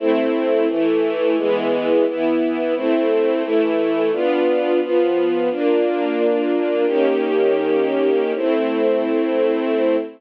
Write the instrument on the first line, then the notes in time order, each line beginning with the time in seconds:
string ensemble 1
0.00 A3 C4 E4
0.69 E3 A3 E4
1.37 E3 G#3 B3
2.06 E3 B3 E4
2.76 A3 C4 E4
3.43 E3 A3 E4
4.12 B3 D4 F4
4.81 F3 B3 F4
5.50 A#3 D4 F4
6.87 D#3 A#3 C#4 G4
8.35 A3 C4 E4